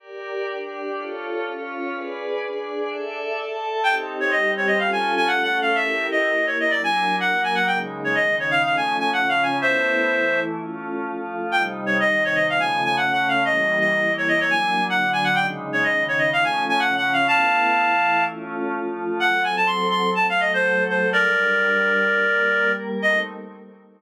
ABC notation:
X:1
M:4/4
L:1/16
Q:1/4=125
K:Ebdor
V:1 name="Clarinet"
z16 | z16 | =g z2 d e2 d e f a2 a (3_g2 g2 f2 | =e3 _e3 d e =d a3 g2 a g |
=g z2 d e2 d f f a2 a (3_g2 f2 a2 | [c=e]8 z8 | =g z2 d e2 d e f a2 a (3_g2 g2 f2 | e3 e3 d e d a3 g2 a g |
=g z2 d e2 d e f a2 a (3_g2 g2 f2 | [f=a]10 z6 | g2 a =a c'2 c'2 a f e c3 c2 | [B=d]14 z2 |
e4 z12 |]
V:2 name="Pad 5 (bowed)"
[=GB=d]4 [=DGd]4 [F=A^c]4 [^CFc]4 | [A_c=d]4 [=DAd]4 [=Ad=e]4 [Ae=a]4 | [CE=G]4 [=G,CG]4 [DF=A]4 [=A,DA]4 | [=E=GB]4 [B,EB]4 [_G,=DB]4 [G,B,B]4 |
[D,A,E]4 [D,E,E]4 [F,=A,^C]4 [^C,F,C]4 | [=A,=B,=E]4 [=E,A,E]4 [A,^C^E]4 [^E,A,E]4 | [C,=G,E]4 [C,E,E]4 [D,F,=A,]4 [D,A,D]4 | [=E,=G,B,]4 [E,B,=E]4 [_G,B,=D]4 [=D,G,D]4 |
[D,A,E]4 [D,E,E]4 [F,=A,^C]4 [^C,F,C]4 | [=A,=B,=E]4 [=E,A,E]4 [A,^C^E]4 [^E,A,E]4 | [G,C=A]8 [G,=A,A]8 | [=G,=DB]8 [G,B,B]8 |
[=A,CE]4 z12 |]